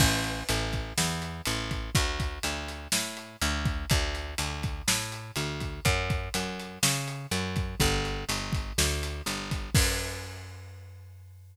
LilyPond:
<<
  \new Staff \with { instrumentName = "Electric Bass (finger)" } { \clef bass \time 4/4 \key fis \minor \tempo 4 = 123 a,,4 a,,4 e,4 a,,4 | d,4 d,4 a,4 d,4 | d,4 d,4 a,4 d,4 | fis,4 fis,4 cis4 fis,4 |
g,,4 g,,4 d,4 g,,4 | fis,1 | }
  \new DrumStaff \with { instrumentName = "Drums" } \drummode { \time 4/4 <cymc bd>8 hh8 hh8 <hh bd>8 sn8 hh8 hh8 <hh bd>8 | <hh bd>8 <hh bd>8 hh8 hh8 sn8 hh8 hh8 <hh bd>8 | <hh bd>8 hh8 hh8 <hh bd>8 sn8 hh8 hh8 <hh bd>8 | <hh bd>8 <hh bd>8 hh8 hh8 sn8 hh8 hh8 <hh bd>8 |
<hh bd>8 hh8 hh8 <hh bd>8 sn8 hh8 hh8 <hh bd>8 | <cymc bd>4 r4 r4 r4 | }
>>